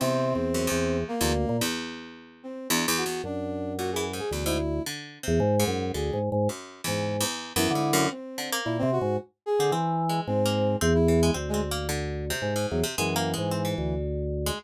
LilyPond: <<
  \new Staff \with { instrumentName = "Drawbar Organ" } { \clef bass \time 3/4 \tempo 4 = 111 \tuplet 3/2 { c4 e,4 e,4 } r16 d,8 bes,16 | r2. | ges,2 d,4 | r8. e,16 aes,8 ges,8 \tuplet 3/2 { d,8 aes,8 aes,8 } |
r8. aes,8. r8 ges,16 d8. | r4 \tuplet 3/2 { bes,8 c8 aes,8 } r8. d16 | e4 aes,4 e,4 | d,2 aes,8 e,16 r16 |
ges,8. aes,8. d,4. | }
  \new Staff \with { instrumentName = "Harpsichord" } { \time 3/4 e,4 ges,16 e,4 e,16 r8 | e,2 \tuplet 3/2 { e,8 e,8 e,8 } | r4 \tuplet 3/2 { bes,8 e8 aes,8 } e,16 aes,16 r8 | \tuplet 3/2 { d4 c4 aes,4 } d8 r8 |
\tuplet 3/2 { ges,4 e,4 e,4 e,8 aes,8 ges,8 } | r8 d16 bes8. r4 r16 c'16 | \tuplet 3/2 { c'4 aes4 bes4 } c'16 r16 e16 aes16 | \tuplet 3/2 { c'8 c'8 bes8 } d8. c8 aes,8 c16 |
\tuplet 3/2 { aes8 bes8 aes8 } c'16 e4~ e16 r16 aes16 | }
  \new Staff \with { instrumentName = "Brass Section" } { \time 3/4 c'2 bes4 | r4. c'8 d'16 r16 ges'8 | d'4 ges'16 aes'16 r16 aes'16 r16 e'8. | r2 aes'8 r8 |
r2 e'4 | c'4 e'16 c'16 ges'8 r8 aes'8 | r4 c'4 r16 e'8. | r16 aes16 r2 ges16 r16 |
e2 r4 | }
>>